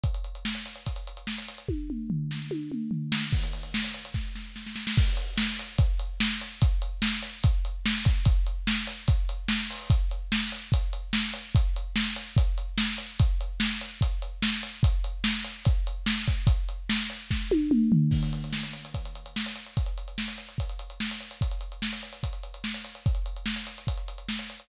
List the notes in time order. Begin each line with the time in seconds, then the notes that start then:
0.04 kick, closed hi-hat
0.14 closed hi-hat
0.24 closed hi-hat
0.35 closed hi-hat
0.45 snare
0.55 closed hi-hat
0.66 closed hi-hat
0.76 closed hi-hat
0.86 kick, closed hi-hat
0.96 closed hi-hat
1.07 closed hi-hat
1.17 closed hi-hat
1.27 snare
1.38 closed hi-hat
1.48 closed hi-hat
1.58 closed hi-hat
1.68 kick, high tom
1.90 mid tom
2.10 floor tom
2.31 snare
2.51 high tom
2.72 mid tom
2.91 floor tom
3.12 snare
3.33 kick, crash
3.43 closed hi-hat
3.53 closed hi-hat
3.63 closed hi-hat
3.74 snare
3.84 closed hi-hat
3.94 closed hi-hat
4.05 closed hi-hat
4.14 kick, snare
4.35 snare
4.56 snare
4.66 snare
4.76 snare
4.87 snare
4.97 kick, crash
5.17 closed hi-hat
5.38 snare
5.59 closed hi-hat
5.78 kick, closed hi-hat
5.99 closed hi-hat
6.20 snare
6.41 closed hi-hat
6.62 kick, closed hi-hat
6.82 closed hi-hat
7.02 snare
7.22 closed hi-hat
7.43 kick, closed hi-hat
7.65 closed hi-hat
7.86 snare
8.05 kick, closed hi-hat
8.25 kick, closed hi-hat
8.46 closed hi-hat
8.67 snare
8.87 closed hi-hat
9.08 kick, closed hi-hat
9.29 closed hi-hat
9.48 snare
9.70 open hi-hat
9.90 kick, closed hi-hat
10.11 closed hi-hat
10.32 snare
10.52 closed hi-hat
10.72 kick, closed hi-hat
10.93 closed hi-hat
11.13 snare
11.33 closed hi-hat
11.55 kick, closed hi-hat
11.76 closed hi-hat
11.96 snare
12.16 closed hi-hat
12.36 kick, closed hi-hat
12.58 closed hi-hat
12.78 snare
12.98 closed hi-hat
13.19 kick, closed hi-hat
13.41 closed hi-hat
13.60 snare
13.81 closed hi-hat
14.01 kick, closed hi-hat
14.22 closed hi-hat
14.42 snare
14.63 closed hi-hat
14.83 kick, closed hi-hat
15.04 closed hi-hat
15.24 snare
15.44 closed hi-hat
15.65 kick, closed hi-hat
15.87 closed hi-hat
16.06 snare
16.27 kick, closed hi-hat
16.47 kick, closed hi-hat
16.69 closed hi-hat
16.89 snare
17.10 closed hi-hat
17.31 kick, snare
17.51 high tom
17.71 mid tom
17.92 floor tom
18.11 kick, crash
18.23 closed hi-hat
18.33 closed hi-hat
18.44 closed hi-hat
18.53 snare
18.63 closed hi-hat
18.73 closed hi-hat
18.85 closed hi-hat
18.94 kick, closed hi-hat
19.05 closed hi-hat
19.15 closed hi-hat
19.26 closed hi-hat
19.36 snare
19.46 closed hi-hat
19.55 closed hi-hat
19.66 closed hi-hat
19.77 kick, closed hi-hat
19.86 closed hi-hat
19.98 closed hi-hat
20.08 closed hi-hat
20.18 snare
20.28 closed hi-hat
20.38 closed hi-hat
20.48 closed hi-hat
20.58 kick, closed hi-hat
20.69 closed hi-hat
20.79 closed hi-hat
20.90 closed hi-hat
21.00 snare
21.11 closed hi-hat
21.20 closed hi-hat
21.31 closed hi-hat
21.41 kick, closed hi-hat
21.51 closed hi-hat
21.61 closed hi-hat
21.72 closed hi-hat
21.82 snare
21.93 closed hi-hat
22.03 closed hi-hat
22.13 closed hi-hat
22.23 kick, closed hi-hat
22.33 closed hi-hat
22.43 closed hi-hat
22.54 closed hi-hat
22.64 snare
22.74 closed hi-hat
22.84 closed hi-hat
22.95 closed hi-hat
23.06 kick, closed hi-hat
23.15 closed hi-hat
23.26 closed hi-hat
23.36 closed hi-hat
23.46 snare
23.56 closed hi-hat
23.67 closed hi-hat
23.78 closed hi-hat
23.87 kick, closed hi-hat
23.97 closed hi-hat
24.08 closed hi-hat
24.18 closed hi-hat
24.29 snare
24.39 closed hi-hat
24.50 closed hi-hat
24.60 closed hi-hat